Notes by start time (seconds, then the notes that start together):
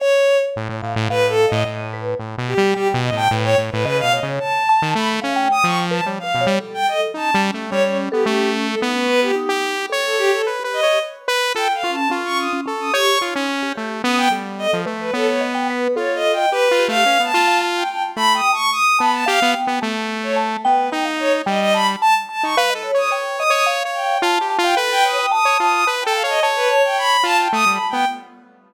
0.00 C#5
0.56 A2
0.69 A2
0.82 A2 F5
0.96 A2
1.09 A2 B4 F5
1.29 A4
1.47 D#5
1.52 A2
1.65 A2 D#5
1.93 B4
2.19 A2
2.38 B2
2.47 G4
2.58 G3
2.74 G3 G4 G5
2.94 B2
3.03 D#5
3.12 A2 G5
3.17 A5
3.30 A2 B4
3.44 C#5 G5
3.58 A2
3.71 A2 B4
3.84 C#3 B4 D#5
4.00 B2 F5
4.12 C#5 D#5
4.23 C#3
4.39 A5
4.69 A5
4.82 D#3
4.95 A3 B5
5.22 C#4 F5
5.36 G5
5.51 D#6
5.64 F3 C#6
5.91 B4 A5
6.06 G3 C#5
6.19 F5
6.23 B4
6.35 B2
6.41 C#5
6.47 G3
6.60 A4
6.74 G5
6.87 A4 D#5
7.14 C#4 D#4 A5
7.34 G3
7.54 A3
7.70 G3 C#4 C#5
7.84 C#4 C#5
8.12 B3 G4 A4
8.25 A3 C#4 G4
8.67 A4
8.81 B3 D#4
8.95 C#4 B4
9.08 C#4 B4
9.22 F4 G4
9.35 D#4 G4
9.49 G4
9.90 A4 C#5
10.04 A4
10.18 G4
10.33 A4
10.47 B4
10.59 G4
10.64 B4
10.73 D#5
10.83 G4 C#5
11.28 B4
11.55 F4 A4 G5
11.74 F5
11.83 C#4 F4
11.92 A5
12.10 C#4 F4
12.25 C#6
12.38 D#6
12.53 C#4
12.66 C#4 A4
12.80 D#6
12.93 G4 C#5 C#6
13.21 D#4 F4
13.35 C#4
13.49 C#4
13.63 G4
13.76 A3 G4
14.04 B3 C#4 D#6
14.17 G5
14.30 G3 A4
14.58 D#5
14.73 F3
14.86 A3 B4
15.00 B4
15.13 B3 A4 C#5
15.28 C#5
15.41 D#5
15.55 G5
15.70 B4
15.96 F4 A4 C#5
16.15 D#5
16.33 G5
16.37 D#5
16.51 G4 B4
16.71 F4
16.79 G4
16.88 A3 F5
17.06 C#4 B4
17.20 B3
17.24 A5
17.34 F4 A4
17.47 F5
17.61 A5
17.76 G5
17.90 G5
18.16 A3 A5 B5
18.35 G5 D#6
18.53 A5 C#6
18.72 D#6
18.99 B3 A5 B5
19.13 A5
19.26 G4 F5
19.42 B3
19.54 G5
19.67 B3
19.82 A3 A5
20.23 C#5
20.36 A5
20.63 B3 B4 G5
20.92 D#4 G5
21.05 F5
21.20 C#5
21.46 G3 D#5 G5
21.61 D#5
21.74 A5 B5
22.01 A5
22.29 A5
22.43 D#4 C#6
22.57 B4 F5
22.70 D#5
22.75 A4
22.83 C#5
22.94 C#5 D#6
23.10 C#5 G5
23.39 D#5 D#6
23.50 C#5 D#6
23.66 F5
23.85 C#5
23.94 G5
24.22 F4 A5
24.41 G4
24.50 A5
24.58 F4
24.63 F5 G5
24.77 A4 B4 B5
24.91 G5
25.04 C#5 D#6
25.19 G5
25.31 A5 D#6
25.45 C#5
25.59 F4 D#6
25.73 D#6
25.87 B4 A5
26.01 G5 A5
26.07 A4
26.13 F5 A5
26.24 C#5
26.29 D#5
26.43 C#5 A5
26.56 B4
26.70 C#5
26.84 G5
26.98 B5
27.23 F4 F5 A5
27.38 G5 A5
27.53 A3 D#6
27.66 G3
27.71 B5
27.90 B3 G5